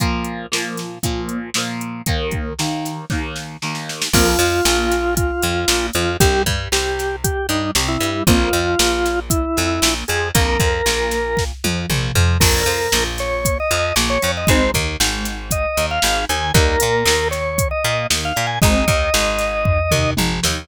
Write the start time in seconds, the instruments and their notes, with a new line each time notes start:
0.00 overdriven guitar A#2 F3 A#3, kick, closed hi-hat
0.24 closed hi-hat
0.52 overdriven guitar A#2 F3 A#3, snare
0.77 snare, closed hi-hat
1.03 overdriven guitar A#2 F3 A#3, kick, closed hi-hat
1.29 closed hi-hat
1.54 overdriven guitar A#2 F3 A#3, snare
1.81 closed hi-hat
2.06 overdriven guitar D#2 D#3 A#3, kick, closed hi-hat
2.31 kick, closed hi-hat
2.59 overdriven guitar D#2 D#3 A#3, snare
2.85 snare, closed hi-hat
3.10 overdriven guitar D#2 D#3 A#3, kick, snare
3.36 snare
3.62 overdriven guitar D#2 D#3 A#3, snare
3.75 snare
3.89 snare
4.02 snare
4.13 electric bass (finger) A#1, overdriven guitar F2 A#3, drawbar organ F4, kick, crash
4.39 electric bass (finger) F2, overdriven guitar F3, closed hi-hat
4.65 electric bass (finger) A#1, overdriven guitar A#2, snare
4.92 snare, closed hi-hat
5.17 drawbar organ F4, kick, closed hi-hat
5.42 electric bass (finger) F2, overdriven guitar F3, closed hi-hat
5.68 electric bass (finger) A#1, overdriven guitar A#2, snare
5.93 electric bass (finger) F2, overdriven guitar F3, drawbar organ F4, closed hi-hat
6.20 electric bass (finger) C2, overdriven guitar G2 C4, drawbar organ G4, kick, closed hi-hat
6.46 electric bass (finger) G2, overdriven guitar G3, kick, closed hi-hat
6.72 electric bass (finger) C2, overdriven guitar C3, drawbar organ G4, snare
6.99 snare, closed hi-hat
7.24 drawbar organ G4, kick, closed hi-hat
7.49 electric bass (finger) G2, overdriven guitar G3, drawbar organ D#4, closed hi-hat
7.75 electric bass (finger) C2, overdriven guitar C3, snare
7.88 drawbar organ E4
8.00 electric bass (finger) G2, overdriven guitar G3, closed hi-hat
8.27 electric bass (finger) A#1, overdriven guitar F2 A#3, drawbar organ F4, kick, closed hi-hat
8.53 electric bass (finger) F2, overdriven guitar F3, closed hi-hat
8.79 electric bass (finger) A#1, overdriven guitar A#2, snare
9.05 snare, closed hi-hat
9.30 drawbar organ E4, kick, closed hi-hat
9.57 electric bass (finger) F2, overdriven guitar F3, closed hi-hat
9.82 electric bass (finger) A#1, overdriven guitar A#2, snare
10.08 electric bass (finger) F2, overdriven guitar F3, drawbar organ G#4, closed hi-hat
10.34 electric bass (finger) A#1, overdriven guitar F2 A#3, drawbar organ A#4, kick, closed hi-hat
10.60 electric bass (finger) F2, overdriven guitar F3, kick, closed hi-hat
10.86 electric bass (finger) A#1, overdriven guitar A#2, snare
11.11 snare, closed hi-hat
11.37 kick, snare
11.64 electric bass (finger) F2, overdriven guitar F3, high tom
11.90 electric bass (finger) A#1, overdriven guitar A#2, mid tom
12.15 electric bass (finger) F2, overdriven guitar F3, floor tom
12.40 electric bass (finger) A#1, overdriven guitar F2 A#3 D4, drawbar organ A#4, kick, crash
12.66 electric bass (finger) F2, overdriven guitar F3, closed hi-hat
12.92 electric bass (finger) A#1, overdriven guitar A#2, snare
13.18 drawbar organ C#5, snare, closed hi-hat
13.45 kick, closed hi-hat
13.60 drawbar organ D#5
13.71 electric bass (finger) F2, overdriven guitar F3, closed hi-hat
13.96 electric bass (finger) A#1, overdriven guitar A#2, snare
14.10 drawbar organ C#5
14.22 electric bass (finger) F2, overdriven guitar F3, closed hi-hat
14.37 drawbar organ D#5
14.47 electric bass (finger) G#1, overdriven guitar G#3 C4 D#4, drawbar organ C5, kick, closed hi-hat
14.74 electric bass (finger) D#2, overdriven guitar D#3, kick, closed hi-hat
15.00 electric bass (finger) G#1, overdriven guitar G#2, snare
15.25 snare, closed hi-hat
15.51 drawbar organ D#5, kick, closed hi-hat
15.77 electric bass (finger) D#2, overdriven guitar D#3, closed hi-hat
15.91 drawbar organ F5
16.02 electric bass (finger) G#1, overdriven guitar G#2, snare
16.29 electric bass (finger) D#2, overdriven guitar D#3, drawbar organ G#5, closed hi-hat
16.54 electric bass (finger) D#2, overdriven guitar G3 A#3 D#4, drawbar organ A#4, kick
16.80 electric bass (finger) A#2, overdriven guitar A#3, closed hi-hat
17.05 electric bass (finger) D#2, overdriven guitar D#3, snare
17.31 drawbar organ C#5, snare, closed hi-hat
17.58 kick, closed hi-hat
17.71 drawbar organ D#5
17.84 electric bass (finger) A#2, overdriven guitar A#3, closed hi-hat
18.10 electric bass (finger) D#2, overdriven guitar D#3, snare
18.25 drawbar organ F5
18.36 electric bass (finger) A#2, overdriven guitar A#3
18.47 drawbar organ G#5
18.62 electric bass (finger) G#1, overdriven guitar G#3 C4 D#4, drawbar organ D#5, kick, closed hi-hat
18.88 electric bass (finger) D#2, overdriven guitar D#3, kick, closed hi-hat
19.14 electric bass (finger) G#1, overdriven guitar G#2, snare
19.39 snare, closed hi-hat
19.65 kick, floor tom
19.91 electric bass (finger) D#2, overdriven guitar D#3, mid tom
20.17 electric bass (finger) G#1, overdriven guitar G#2, high tom
20.43 electric bass (finger) D#2, overdriven guitar D#3, snare